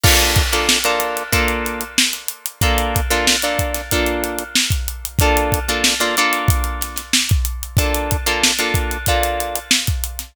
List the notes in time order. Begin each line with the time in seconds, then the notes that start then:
0.03 A#3 D4 F4 A4, kick, crash
0.19 snare, closed hi-hat
0.36 kick, snare, closed hi-hat
0.52 A#3 D4 F4 A4, closed hi-hat
0.69 snare
0.84 A#3 D4 F4 A4, closed hi-hat
1.00 closed hi-hat
1.17 closed hi-hat
1.32 A#3 D4 F4 A4, kick, closed hi-hat
1.48 closed hi-hat
1.66 closed hi-hat
1.81 closed hi-hat
1.98 snare
2.13 closed hi-hat
2.28 closed hi-hat
2.46 closed hi-hat
2.61 A#3 D4 F4 A4, kick, closed hi-hat
2.78 closed hi-hat
2.96 kick, closed hi-hat
3.10 A#3 D4 F4 A4, snare, closed hi-hat
3.27 snare
3.42 A#3 D4 F4 A4, closed hi-hat
3.59 kick, closed hi-hat
3.74 snare, closed hi-hat
3.91 A#3 D4 F4 A4, kick, closed hi-hat
4.06 closed hi-hat
4.24 closed hi-hat
4.38 closed hi-hat
4.55 snare
4.70 kick, closed hi-hat
4.88 closed hi-hat
5.05 closed hi-hat
5.19 A#3 D4 F4 A4, kick, closed hi-hat
5.37 closed hi-hat
5.52 kick, closed hi-hat
5.68 A#3 D4 F4 A4, closed hi-hat
5.84 snare
6.00 A#3 D4 F4 A4, snare, closed hi-hat
6.17 A#3 D4 F4 A4, closed hi-hat
6.33 closed hi-hat
6.48 kick, closed hi-hat
6.64 closed hi-hat
6.81 snare, closed hi-hat
6.96 snare, closed hi-hat
7.13 snare
7.29 kick, closed hi-hat
7.45 closed hi-hat
7.63 closed hi-hat
7.77 A#3 D4 F4 A4, kick, closed hi-hat
7.94 closed hi-hat
8.11 kick, closed hi-hat
8.26 A#3 D4 F4 A4, closed hi-hat
8.44 snare
8.59 A#3 D4 F4 A4, closed hi-hat
8.74 kick, closed hi-hat
8.91 closed hi-hat
9.06 A#3 D4 F4 A4, kick, closed hi-hat
9.23 closed hi-hat
9.40 closed hi-hat
9.56 closed hi-hat
9.71 snare
9.87 kick, closed hi-hat
10.04 closed hi-hat
10.19 snare, closed hi-hat